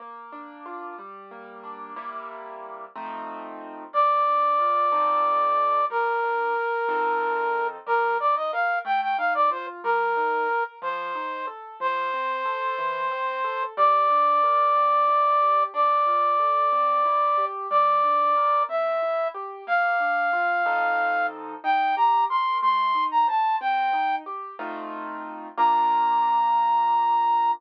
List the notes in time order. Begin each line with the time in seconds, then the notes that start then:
0.00 A#3
0.32 D4
0.66 F4
0.98 G3
1.31 A#3
1.64 D4
1.96 C3 G3 A#3 E4
2.95 F3 A3 C4 D#4
3.93 A#3 D5
4.26 D4
4.59 F4
4.92 F3 C4 D#4 A4
5.90 G3 A#4
6.23 D4
6.56 A#4
6.89 F3 C4 D#4 A4
7.86 G3 A#4
8.20 D#4 D5
8.36 D#5
8.52 A#4 F5
8.85 A3 G5
9.02 G5
9.18 D#4 F5
9.34 D5
9.51 F4 C5
9.84 G3 A#4
10.17 D#4
10.49 A#4
10.82 F3 C5
11.15 D#4
11.47 A4
11.80 F3 C5
12.14 C4
12.45 A4
12.78 E3
13.11 C4
13.44 A4
13.77 G3 D5
14.10 D4
14.43 A#4
14.76 C4
15.08 E4
15.41 G4
15.74 D4 D5
16.06 F4
16.39 A4
16.72 C4
17.05 E4
17.38 G4
17.70 G3 D5
18.03 D4
18.36 A#4
18.69 C4 E5
19.02 E4
19.34 G4
19.67 A#3 F5
20.00 D4
20.33 F4
20.66 F3 C4 D#4 A4
21.64 D#4 G5
21.97 G4 A#5
22.30 A#4 C6
22.62 A3 C6
22.95 D#4
23.11 A#5
23.28 C5 A5
23.61 C4 G5
23.93 D#4
24.26 G4
24.59 A3 C4 D#4 F4
25.57 A#3 D4 F4 A#5